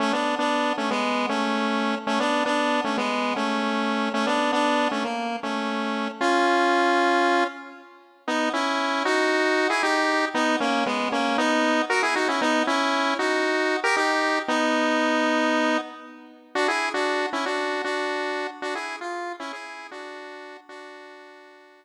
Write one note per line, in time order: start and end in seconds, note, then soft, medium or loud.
0.00 0.12 A3 medium
0.00 0.12 C#4 medium
0.13 0.35 B3 medium
0.13 0.35 D4 medium
0.39 0.73 B3 medium
0.39 0.73 D4 medium
0.78 0.90 A3 medium
0.78 0.90 C#4 medium
0.91 1.26 G#3 medium
0.91 1.26 B3 medium
1.29 1.95 A3 medium
1.29 1.95 C#4 medium
2.07 2.19 A3 medium
2.07 2.19 C#4 medium
2.20 2.44 B3 medium
2.20 2.44 D4 medium
2.46 2.81 B3 medium
2.46 2.81 D4 medium
2.84 2.97 A3 medium
2.84 2.97 C#4 medium
2.97 3.34 G#3 medium
2.97 3.34 B3 medium
3.36 4.09 A3 medium
3.36 4.09 C#4 medium
4.14 4.26 A3 medium
4.14 4.26 C#4 medium
4.27 4.52 B3 medium
4.27 4.52 D4 medium
4.53 4.88 B3 medium
4.53 4.88 D4 medium
4.91 5.04 A3 medium
4.91 5.04 C#4 medium
5.04 5.37 A#3 medium
5.43 6.08 A3 medium
5.43 6.08 C#4 medium
6.21 7.44 C#4 medium
6.21 7.44 F4 medium
8.28 8.49 B3 medium
8.28 8.49 D#4 medium
8.53 9.03 C#4 medium
8.53 9.03 E4 medium
9.05 9.68 D#4 medium
9.05 9.68 F#4 medium
9.70 9.82 E4 medium
9.70 9.82 G#4 medium
9.83 10.25 D#4 medium
9.83 10.25 G4 medium
10.34 10.56 B3 medium
10.34 10.56 D#4 medium
10.60 10.84 A#3 medium
10.60 10.84 C#4 medium
10.86 11.09 G#3 medium
10.86 11.09 B3 medium
11.12 11.37 A#3 medium
11.12 11.37 C#4 medium
11.38 11.82 B3 medium
11.38 11.82 D#4 medium
11.90 12.02 F#4 medium
11.90 12.02 A#4 medium
12.03 12.15 E4 medium
12.03 12.15 G#4 medium
12.16 12.28 D#4 medium
12.16 12.28 F#4 medium
12.28 12.41 C#4 medium
12.28 12.41 E4 medium
12.41 12.63 B3 medium
12.41 12.63 D#4 medium
12.67 13.14 C#4 medium
12.67 13.14 E4 medium
13.19 13.77 D#4 medium
13.19 13.77 F#4 medium
13.84 13.96 G4 medium
13.84 13.96 A#4 medium
13.97 14.39 D#4 medium
13.97 14.39 G4 medium
14.48 15.77 B3 medium
14.48 15.77 D#4 medium
16.55 16.67 D4 medium
16.55 16.67 F#4 medium
16.68 16.89 E4 medium
16.68 16.89 G#4 medium
16.94 17.26 D4 medium
16.94 17.26 F#4 medium
17.33 17.45 C#4 medium
17.33 17.45 E4 medium
17.46 17.82 D4 medium
17.46 17.82 F#4 medium
17.84 18.47 D4 medium
17.84 18.47 F#4 medium
18.62 18.74 D4 medium
18.62 18.74 F#4 loud
18.75 18.96 E4 medium
18.75 18.96 G#4 medium
19.01 19.33 F4 medium
19.40 19.52 C#4 medium
19.40 19.52 E4 loud
19.53 19.87 E4 medium
19.53 19.87 G#4 medium
19.91 20.57 D4 medium
19.91 20.57 F#4 medium
20.69 21.85 D4 medium
20.69 21.85 F#4 medium